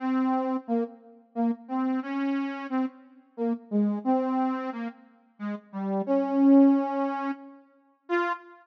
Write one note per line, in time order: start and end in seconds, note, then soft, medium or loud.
0.00 0.57 C4 medium
0.68 0.84 A#3 medium
1.35 1.51 A#3 medium
1.68 2.00 C4 medium
2.02 2.67 C#4 medium
2.70 2.86 C4 medium
3.37 3.53 A#3 medium
3.71 3.99 G#3 medium
4.04 4.70 C4 medium
4.72 4.88 A#3 medium
5.39 5.55 G#3 medium
5.72 6.02 G3 medium
6.06 7.31 C#4 medium
8.09 8.32 F4 loud